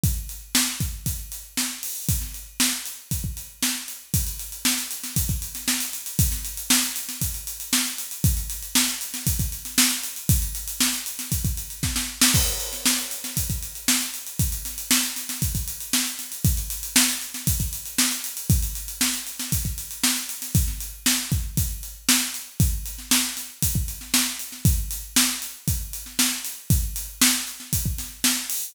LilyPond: \new DrumStaff \drummode { \time 4/4 \tempo 4 = 117 <hh bd>8 hh8 sn8 <hh bd>8 <hh bd>8 hh8 sn8 hho8 | <hh bd>16 sn16 hh8 sn16 sn16 hh8 <hh bd>16 bd16 hh8 sn8 hh8 | <hh bd>16 hh16 hh16 hh16 sn16 hh16 hh16 <hh sn>16 <hh bd>16 <hh bd>16 hh16 <hh sn>16 sn16 hh16 hh16 hh16 | <hh bd>16 <hh sn>16 hh16 hh16 sn16 hh16 hh16 <hh sn>16 <hh bd>16 hh16 hh16 hh16 sn16 hh16 hh16 hh16 |
<hh bd>16 hh16 hh16 hh16 sn16 <hh sn>16 hh16 <hh sn>16 <hh bd>16 <hh bd>16 hh16 <hh sn>16 sn16 hh16 hh16 hh16 | <hh bd>16 hh16 hh16 hh16 sn16 <hh sn>16 hh16 <hh sn>16 <hh bd>16 <hh bd>16 hh16 hh16 <bd sn>16 sn8 sn16 | <cymc bd>16 hh16 hh16 <hh sn>16 sn16 hh16 hh16 <hh sn>16 <hh bd>16 <hh bd>16 hh16 hh16 sn16 hh16 hh16 hh16 | <hh bd>16 hh16 <hh sn>16 hh16 sn16 hh16 <hh sn>16 <hh sn>16 <hh bd>16 <hh bd>16 hh16 hh16 sn16 hh16 <hh sn>16 hh16 |
<hh bd>16 hh16 hh16 hh16 sn16 hh16 hh16 <hh sn>16 <hh bd>16 <hh bd>16 hh16 hh16 sn16 hh16 hh16 hh16 | <hh bd>16 hh16 hh16 hh16 sn16 hh16 hh16 <hh sn>16 <hh bd>16 <hh bd>16 hh16 hh16 sn16 hh16 hh16 <hh sn>16 | <hh bd>16 sn16 hh8 sn8 <hh bd>8 <hh bd>8 hh8 sn8 hh8 | <hh bd>8 hh16 sn16 sn8 <hh sn>8 <hh bd>16 bd16 hh16 sn16 sn8 hh16 sn16 |
<hh bd>8 hh8 sn8 hh8 <hh bd>8 hh16 sn16 sn8 hh8 | <hh bd>8 hh8 sn8 hh16 sn16 <hh bd>16 bd16 <hh sn>8 sn8 hho8 | }